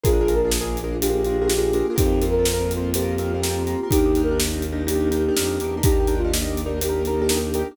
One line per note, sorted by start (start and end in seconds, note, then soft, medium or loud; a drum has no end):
0.03 1.82 A#1 medium
0.03 1.95 A#3 medium
0.03 0.10 D4 medium
0.03 1.95 D4 medium
0.03 0.10 F4 loud
0.03 1.95 F4 medium
0.03 0.34 F4 medium
0.03 0.10 G#4 loud
0.03 1.95 G#4 medium
0.03 0.34 G#4 medium
0.03 0.10 A#4 loud
0.03 kick loud
0.03 closed hi-hat medium
0.13 0.19 D4 medium
0.13 0.19 F4 medium
0.13 0.19 G#4 medium
0.13 0.19 A#4 medium
0.21 0.27 D4 medium
0.21 0.27 F4 medium
0.21 0.27 G#4 medium
0.21 0.27 A#4 medium
0.28 0.41 D4 medium
0.28 0.41 F4 medium
0.28 0.41 G#4 medium
0.28 0.41 A#4 medium
0.28 closed hi-hat medium
0.35 0.50 A#4 medium
0.44 0.57 D4 medium
0.44 0.57 F4 medium
0.44 0.57 G#4 medium
0.44 0.57 A#4 medium
0.51 snare loud
0.61 0.80 D4 medium
0.61 0.80 F4 medium
0.61 0.80 G#4 medium
0.61 0.80 A#4 medium
0.77 closed hi-hat medium
0.84 0.97 D4 medium
0.84 0.97 F4 medium
0.84 0.97 G#4 medium
0.84 0.97 A#4 medium
1.01 1.08 D4 medium
1.01 1.08 F4 medium
1.01 1.87 G4 medium
1.01 1.08 G#4 medium
1.01 1.08 A#4 medium
1.01 closed hi-hat loud
1.09 1.22 D4 medium
1.09 1.22 F4 medium
1.09 1.22 G#4 medium
1.09 1.22 A#4 medium
1.25 1.39 D4 medium
1.25 1.39 F4 medium
1.25 1.39 G#4 medium
1.25 1.39 A#4 medium
1.25 closed hi-hat medium
1.41 1.47 D4 medium
1.41 1.47 F4 medium
1.41 1.47 G#4 medium
1.41 1.47 A#4 medium
1.47 1.54 D4 medium
1.47 1.54 F4 medium
1.47 1.54 G#4 medium
1.47 1.54 A#4 medium
1.47 snare loud
1.58 1.70 D4 medium
1.58 1.70 F4 medium
1.58 1.70 G#4 medium
1.58 1.70 A#4 medium
1.73 1.87 D4 medium
1.73 1.87 F4 medium
1.73 1.87 G#4 medium
1.73 1.87 A#4 medium
1.73 closed hi-hat medium
1.90 1.96 D4 medium
1.90 1.95 F4 medium
1.90 1.96 G#4 medium
1.90 1.95 A#4 medium
1.96 3.75 F2 loud
1.96 3.90 A#3 medium
1.96 2.02 C4 medium
1.96 3.90 C4 medium
1.96 2.25 D#4 medium
1.96 2.02 F4 medium
1.96 3.90 F4 medium
1.96 2.25 G4 medium
1.96 2.02 A#4 medium
1.96 kick loud
1.96 closed hi-hat loud
2.06 2.12 C4 medium
2.06 2.12 F4 medium
2.06 2.12 A#4 medium
2.12 2.19 C4 medium
2.12 2.19 F4 medium
2.12 2.19 A#4 medium
2.22 2.35 C4 medium
2.22 2.35 F4 medium
2.22 2.35 A#4 medium
2.22 closed hi-hat medium
2.31 2.45 A#4 medium
2.39 2.52 C4 medium
2.39 2.52 F4 medium
2.39 2.52 A#4 medium
2.45 snare loud
2.53 2.73 C4 medium
2.53 2.73 F4 medium
2.53 2.73 A#4 medium
2.71 closed hi-hat medium
2.77 2.90 C4 medium
2.77 2.90 F4 medium
2.77 2.90 A#4 medium
2.94 3.01 C4 medium
2.94 3.01 F4 medium
2.94 3.87 G4 medium
2.94 3.01 A#4 medium
2.94 closed hi-hat loud
3.02 3.15 C4 medium
3.02 3.15 F4 medium
3.02 3.15 A#4 medium
3.18 3.32 C4 medium
3.18 3.32 F4 medium
3.18 3.32 A#4 medium
3.18 closed hi-hat medium
3.34 3.41 C4 medium
3.34 3.41 F4 medium
3.34 3.41 A#4 medium
3.42 3.49 C4 medium
3.42 3.49 F4 medium
3.42 3.49 A#4 medium
3.42 snare loud
3.50 3.63 C4 medium
3.50 3.63 F4 medium
3.50 3.63 A#4 medium
3.67 3.80 C4 medium
3.67 3.80 F4 medium
3.67 3.80 A#4 medium
3.67 closed hi-hat medium
3.83 3.90 C4 medium
3.83 3.90 F4 medium
3.83 3.90 A#4 medium
3.90 5.30 D#2 loud
3.90 5.83 A#3 medium
3.90 3.97 D4 medium
3.90 5.83 D4 medium
3.90 3.97 D#4 medium
3.90 4.22 D#4 medium
3.90 5.83 D#4 medium
3.90 3.97 G4 medium
3.90 4.22 G4 medium
3.90 5.83 G4 medium
3.90 3.97 A#4 loud
3.90 kick medium
3.90 closed hi-hat loud
3.98 4.04 D4 medium
3.98 4.04 D#4 medium
3.98 4.04 G4 medium
3.98 4.04 A#4 medium
4.06 4.12 D4 medium
4.06 4.12 D#4 medium
4.06 4.12 G4 medium
4.06 4.12 A#4 medium
4.15 4.30 D4 medium
4.15 4.30 D#4 medium
4.15 4.30 G4 medium
4.15 4.30 A#4 medium
4.15 closed hi-hat medium
4.23 4.38 A#4 medium
4.31 4.44 D4 medium
4.31 4.44 D#4 medium
4.31 4.44 G4 medium
4.31 4.44 A#4 medium
4.40 snare loud
4.47 4.66 D4 medium
4.47 4.66 D#4 medium
4.47 4.66 G4 medium
4.47 4.66 A#4 medium
4.62 closed hi-hat medium
4.72 4.85 D4 medium
4.72 4.85 D#4 medium
4.72 4.85 G4 medium
4.72 4.85 A#4 medium
4.87 4.93 D4 medium
4.87 4.93 D#4 medium
4.87 4.93 G4 medium
4.87 5.76 G4 medium
4.87 4.93 A#4 medium
4.87 closed hi-hat medium
4.96 5.08 D4 medium
4.96 5.08 D#4 medium
4.96 5.08 G4 medium
4.96 5.08 A#4 medium
5.11 5.24 D4 medium
5.11 5.24 D#4 medium
5.11 5.24 G4 medium
5.11 5.24 A#4 medium
5.11 closed hi-hat medium
5.28 5.35 D4 medium
5.28 5.35 D#4 medium
5.28 5.35 G4 medium
5.28 5.35 A#4 medium
5.36 5.58 F2 medium
5.36 5.43 D4 medium
5.36 5.43 D#4 medium
5.36 5.43 G4 medium
5.36 5.43 A#4 medium
5.36 snare loud
5.45 5.58 D4 medium
5.45 5.58 D#4 medium
5.45 5.58 G4 medium
5.45 5.58 A#4 medium
5.60 5.82 E2 medium
5.60 5.74 D4 medium
5.60 5.74 D#4 medium
5.60 5.74 G4 medium
5.60 5.74 A#4 medium
5.60 closed hi-hat medium
5.77 5.84 D4 medium
5.77 5.84 D#4 medium
5.77 5.84 G4 medium
5.77 5.84 A#4 medium
5.83 7.63 D#2 medium
5.83 7.76 A#3 medium
5.83 5.91 D4 medium
5.83 7.76 D4 medium
5.83 6.14 D#4 medium
5.83 5.91 D#4 loud
5.83 7.76 D#4 medium
5.83 6.14 G4 medium
5.83 5.91 G4 medium
5.83 7.76 G4 medium
5.83 5.91 A#4 loud
5.83 kick loud
5.83 closed hi-hat loud
5.92 5.98 D4 medium
5.92 5.98 D#4 medium
5.92 5.98 G4 medium
5.92 5.98 A#4 medium
6.00 6.06 D4 medium
6.00 6.06 D#4 medium
6.00 6.06 G4 medium
6.00 6.06 A#4 medium
6.07 6.21 D4 medium
6.07 6.21 D#4 medium
6.07 6.21 G4 medium
6.07 6.21 A#4 medium
6.07 closed hi-hat medium
6.18 6.31 F4 medium
6.24 6.37 D4 medium
6.24 6.37 D#4 medium
6.24 6.37 G4 medium
6.24 6.37 A#4 medium
6.33 snare loud
6.42 6.61 D4 medium
6.42 6.61 D#4 medium
6.42 6.61 G4 medium
6.42 6.61 A#4 medium
6.57 closed hi-hat medium
6.66 6.79 D4 medium
6.66 6.79 D#4 medium
6.66 6.79 G4 medium
6.66 6.79 A#4 medium
6.81 6.88 D4 medium
6.81 6.88 D#4 medium
6.81 6.88 G4 medium
6.81 7.61 G4 medium
6.81 6.88 A#4 medium
6.81 closed hi-hat loud
6.89 7.02 D4 medium
6.89 7.02 D#4 medium
6.89 7.02 G4 medium
6.89 7.02 A#4 medium
7.05 7.20 D4 medium
7.05 7.20 D#4 medium
7.05 7.20 G4 medium
7.05 7.20 A#4 medium
7.05 closed hi-hat medium
7.21 7.28 D4 medium
7.21 7.28 D#4 medium
7.21 7.28 G4 medium
7.21 7.28 A#4 medium
7.29 7.36 D4 medium
7.29 7.36 D#4 medium
7.29 7.36 G4 medium
7.29 7.36 A#4 medium
7.29 snare loud
7.37 7.50 D4 medium
7.37 7.50 D#4 medium
7.37 7.50 G4 medium
7.37 7.50 A#4 medium
7.54 7.67 D4 medium
7.54 7.67 D#4 medium
7.54 7.67 G4 medium
7.54 7.67 A#4 medium
7.54 closed hi-hat medium
7.71 7.76 D4 medium
7.71 7.76 D#4 medium
7.71 7.76 G4 medium
7.71 7.76 A#4 medium